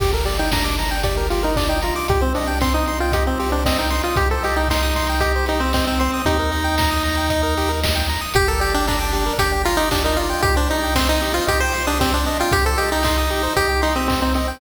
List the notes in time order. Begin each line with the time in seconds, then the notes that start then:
0.00 G1 G4, kick, crash
0.13 A4 A#4
0.25 G4 D5, open hi-hat
0.39 D#4 G5
0.52 D4 A#5, kick, snare
0.64 D6
0.79 A#5, open hi-hat
0.91 G5
1.03 G4 D5, kick, closed hi-hat
1.17 A#4
1.30 F4 G4, open hi-hat
1.43 D#4 A#4
1.56 D4 D5, kick, clap
1.69 D#4 G5
1.82 F4 A#5, open hi-hat
1.96 D6
2.08 C2 G4, kick, closed hi-hat
2.21 C4 C5
2.35 D4 D#5, open hi-hat
2.47 G5
2.61 C4 C6, kick, clap
2.74 D#4 D#6
2.86 C6, open hi-hat
3.00 F4 G5
3.12 G4 D#5, kick, closed hi-hat
3.27 C4 C5
3.39 G4, open hi-hat
3.52 D4 C5
3.65 C4 D#5, kick, snare
3.78 D#4 G5
3.90 C6, open hi-hat
4.04 F4 D#6
4.16 C2 G4, kick, closed hi-hat
4.31 A4 C5
4.43 G4 D#5, open hi-hat
4.56 D#4 G5
4.68 D#4 C6, kick, snare
4.82 D#6
4.96 C6, kick, open hi-hat
5.09 G5
5.20 G4 D#5, kick, closed hi-hat
5.36 C5
5.46 D#4 G4, open hi-hat
5.60 C4 C5
5.73 C4 D#5, kick, clap
5.87 C4 G5
5.99 C4 C6, open hi-hat
6.14 D#6
6.25 D#2 D#4 G4, kick, closed hi-hat
6.39 A#4
6.52 D#5, open hi-hat
6.64 G5
6.78 A#5, kick, snare
6.91 D#6
7.04 A#5, open hi-hat
7.17 G5
7.29 D#5, kick, closed hi-hat
7.43 A#4
7.57 G4, open hi-hat
7.69 A#4
7.83 D#5, kick, snare
7.95 G5
8.09 A#5, open hi-hat
8.21 D#6
8.34 G1 G4, kick, closed hi-hat
8.48 A4 A#4
8.60 G4 D5, open hi-hat
8.74 D4 G5
8.87 D4 A#5, kick, clap
8.99 D6
9.13 G4, open hi-hat
9.26 A#4
9.38 G1 G4 D5, kick, closed hi-hat
9.52 G5
9.65 F4 A#5, open hi-hat
9.77 D#4 D6
9.91 D4 G4, kick, clap
10.04 D#4 A#4
10.17 F4 D5, open hi-hat
10.30 G5
10.42 C2 G4, kick, closed hi-hat
10.56 D4 C5
10.70 D#4 D#5, open hi-hat
10.83 G5
10.95 C4 C6, kick, snare
11.09 D#4 D#6
11.21 G4, open hi-hat
11.34 F4 C5
11.47 C2 G4 D#5, kick, closed hi-hat
11.60 C5 G5
11.72 C6, open hi-hat
11.87 D4 D#6
12.00 C4 G4, kick, clap
12.13 D4 C5
12.26 D#5, open hi-hat
12.40 F4 G5
12.52 C2 G4, kick, closed hi-hat
12.65 A4 C5
12.78 G4 D#5, open hi-hat
12.92 D#4 G5
13.03 D#4 C6, kick, clap
13.18 D#6
13.30 G4, open hi-hat
13.43 C5
13.56 C2 G4 D#5, kick, closed hi-hat
13.69 G5
13.82 D#4 C6, open hi-hat
13.96 C4 D#6
14.08 C4 G4, kick, clap
14.22 C4 C5
14.34 C4 D#5, open hi-hat
14.48 G5